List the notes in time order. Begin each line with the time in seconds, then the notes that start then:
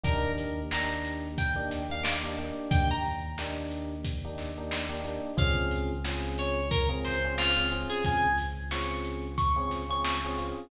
0.03 D#2 A#3 D4 D#4 G4 A#4, kick, closed hi-hat
0.38 closed hi-hat
0.71 A#3 D4 D#4 G4 A#5, snare
1.04 closed hi-hat
1.38 G5, kick, closed hi-hat
1.56 A#3 D4 D#4 G4
1.71 snare, closed hi-hat
1.89 A#3 D4 D#4 G4 F5
2.03 D6, snare
2.24 A#3 D4 D#4 G4
2.38 A#3 D4 D#4 G4, closed hi-hat
2.71 D#2 G5, kick, closed hi-hat
2.91 A#5
3.04 closed hi-hat
3.38 A#3 D4 D#4 G4, snare
3.71 closed hi-hat
4.04 kick, closed hi-hat
4.24 A#3 D4 D#4 G4
4.38 snare, closed hi-hat
4.58 A#3 D4 D#4 G4
4.71 snare
4.89 A#3 D4 D#4 G4
5.04 A#3 D4 D#4 G4, closed hi-hat
5.37 C#2 C4 C#4 F4 G#4 F5, kick, closed hi-hat
5.71 closed hi-hat
6.04 C4 C#4 F4 G#4, snare
6.38 C#5, closed hi-hat
6.71 A#4, kick, closed hi-hat
6.89 C4 C#4 F4 G#4
7.04 C5, snare, closed hi-hat
7.24 C4 C#4 F4 G#4
7.38 F4, snare
7.57 C4 C#4 F4 G#4
7.71 C4 C#4 F4 G#4, closed hi-hat
7.90 G#4
8.04 C#2 G#5, kick, closed hi-hat
8.38 snare, closed hi-hat
8.71 C4 C#4 F4 G#4 C#6, snare
9.04 closed hi-hat
9.38 C#6, kick, closed hi-hat
9.56 C4 C#4 F4 G#4
9.71 snare, closed hi-hat
9.89 C4 C#4 F4 G#4 C#6
10.04 C#6, snare
10.24 C4 C#4 F4 G#4
10.38 C4 C#4 F4 G#4, closed hi-hat